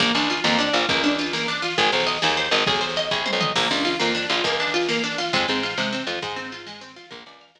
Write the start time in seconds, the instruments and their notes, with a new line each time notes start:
0.00 electric bass (finger) A#1, pizzicato strings A#3, kick, snare
0.07 snare
0.15 electric bass (finger) C#2, pizzicato strings D4, snare
0.22 snare
0.30 pizzicato strings F4, snare
0.37 snare
0.44 electric bass (finger) F2, pizzicato strings A#3, snare
0.52 snare
0.59 pizzicato strings D4, snare
0.67 snare
0.73 electric bass (finger) A#1, pizzicato strings F4, snare
0.82 snare
0.89 electric bass (finger) C#2, pizzicato strings A#3, kick, snare
0.96 snare
1.04 pizzicato strings D4, snare
1.11 snare
1.18 pizzicato strings F4, snare
1.26 snare
1.33 pizzicato strings A#3, snare
1.41 snare
1.48 pizzicato strings D4, snare
1.55 snare
1.62 pizzicato strings F4, snare
1.70 snare
1.78 electric bass (finger) G#1, pizzicato strings G#4, kick, snare
1.85 snare
1.92 electric bass (finger) B1, pizzicato strings C5, snare
2.00 snare
2.07 pizzicato strings D#5, snare
2.15 snare
2.22 electric bass (finger) D#2, pizzicato strings G#4, snare
2.29 snare
2.37 pizzicato strings C5, snare
2.45 snare
2.51 electric bass (finger) G#1, pizzicato strings D#5, snare
2.59 snare
2.66 electric bass (finger) B1, pizzicato strings G#4, kick, snare
2.74 snare
2.81 pizzicato strings C5, snare
2.89 snare
2.96 pizzicato strings D#5, snare
3.11 electric bass (finger) C2, pizzicato strings G#4, kick, snare
3.26 pizzicato strings C5, high tom
3.33 electric bass (finger) B1
3.41 pizzicato strings D#5, mid tom
3.55 electric bass (finger) A#1, pizzicato strings A#3, kick, snare, crash
3.63 snare
3.70 electric bass (finger) C#2, pizzicato strings D4, snare
3.78 snare
3.85 pizzicato strings F4, snare
3.93 snare
4.00 electric bass (finger) F2, pizzicato strings A#3, snare
4.08 snare
4.15 pizzicato strings D4, snare
4.22 snare
4.30 electric bass (finger) A#1, pizzicato strings F4, snare
4.37 snare
4.44 electric bass (finger) C#2, pizzicato strings A#3, kick, snare
4.52 snare
4.59 pizzicato strings D4, snare
4.67 snare
4.74 pizzicato strings F4, snare
4.81 snare
4.89 pizzicato strings A#3, snare
4.96 snare
5.04 pizzicato strings D4, snare
5.11 snare
5.18 pizzicato strings F4, snare
5.26 snare
5.33 electric bass (finger) F2, pizzicato strings G#3, kick, snare
5.41 snare
5.48 electric bass (finger) G#2, pizzicato strings C4, snare
5.56 snare
5.63 pizzicato strings F4, snare
5.70 snare
5.77 electric bass (finger) C3, pizzicato strings G#3, snare
5.85 snare
5.93 pizzicato strings C4, snare
6.00 snare
6.07 electric bass (finger) F2, pizzicato strings F4, snare
6.15 snare
6.22 electric bass (finger) G#2, pizzicato strings G#3, kick, snare
6.29 snare
6.36 pizzicato strings C4, snare
6.45 snare
6.52 pizzicato strings F4, snare
6.59 snare
6.66 pizzicato strings G#3, snare
6.74 snare
6.81 pizzicato strings C4, snare
6.89 snare
6.96 pizzicato strings F4, snare
7.04 snare
7.11 electric bass (finger) A#1, pizzicato strings A#4, kick, snare
7.19 snare
7.26 electric bass (finger) C#2, pizzicato strings D5, snare
7.33 snare
7.40 pizzicato strings F5, snare
7.48 snare
7.55 electric bass (finger) F2, pizzicato strings A#4, snare